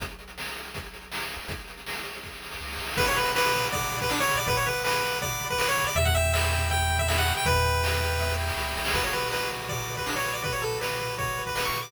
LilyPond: <<
  \new Staff \with { instrumentName = "Lead 1 (square)" } { \time 4/4 \key b \minor \tempo 4 = 161 r1 | r1 | b'16 cis''16 b'8 b'4 d''8. b'16 d'16 cis''8 d''16 | b'16 cis''16 b'8 b'4 d''8. b'16 b'16 cis''8 d''16 |
e''16 fis''16 e''8 e''4 g''8. e''16 e''16 fis''8 g''16 | b'2~ b'8 r4. | b'16 cis''16 b'8 b'8 r8 d''8. b'16 d'16 cis''8 d''16 | b'16 cis''16 a'8 b'4 cis''8. b'16 b'16 cis'''8 d'''16 | }
  \new Staff \with { instrumentName = "Lead 1 (square)" } { \time 4/4 \key b \minor r1 | r1 | fis''8 b''8 d'''8 b''8 fis''8 b''8 d'''8 b''8 | fis''8 b''8 d'''8 b''8 fis''8 b''8 d'''8 b''8 |
e''8 g''8 b''8 g''8 e''8 g''8 b''8 g''8 | e''8 g''8 b''8 g''8 e''8 g''8 b''8 g''8 | fis'8 b'8 d''8 b'8 fis'8 b'8 d''8 b'8 | fis'8 b'8 d''8 b'8 fis'8 b'8 d''8 b'8 | }
  \new Staff \with { instrumentName = "Synth Bass 1" } { \clef bass \time 4/4 \key b \minor b,,1 | b,,2. cis,8 c,8 | b,,1 | b,,1 |
e,1 | e,2. cis,8 c,8 | b,,1~ | b,,1 | }
  \new DrumStaff \with { instrumentName = "Drums" } \drummode { \time 4/4 <hh bd>16 hh16 hh16 hh16 sn16 hh16 hh16 hh16 <hh bd>16 hh16 hh16 hh16 sn16 hh16 hh16 hho16 | <hh bd>16 hh16 hh16 hh16 sn16 hh16 hh16 hh16 <bd sn>16 sn16 sn16 sn16 sn32 sn32 sn32 sn32 sn32 sn32 sn32 sn32 | <cymc bd>16 tomfh16 tomfh16 tomfh16 sn16 tomfh16 tomfh16 tomfh16 <bd tomfh>16 tomfh16 tomfh16 <bd tomfh>16 sn16 tomfh16 tomfh16 tomfh16 | <bd tomfh>16 tomfh16 tomfh16 tomfh16 sn16 tomfh16 tomfh16 tomfh16 <bd tomfh>16 tomfh16 tomfh16 <bd tomfh>16 sn16 tomfh16 tomfh16 tomfh16 |
tomfh16 <bd tomfh>16 tomfh16 tomfh16 sn16 tomfh16 tomfh16 tomfh16 <bd tomfh>16 tomfh16 tomfh16 <bd tomfh>16 sn16 tomfh16 tomfh16 tomfh16 | <bd tomfh>16 tomfh16 tomfh16 tomfh16 sn16 tomfh16 tomfh16 tomfh16 <bd sn>16 sn16 sn16 sn16 sn16 sn16 sn16 sn16 | <cymc bd>16 tomfh16 tomfh16 tomfh16 sn16 tomfh16 tomfh16 tomfh16 <bd tomfh>16 tomfh16 tomfh16 <bd tomfh>16 sn16 tomfh16 tomfh16 tomfh16 | <bd tomfh>16 tomfh16 tomfh16 tomfh16 sn16 tomfh16 tomfh16 tomfh16 <bd tomfh>16 tomfh16 tomfh16 <bd tomfh>16 sn16 tomfh16 tomfh16 tomfh16 | }
>>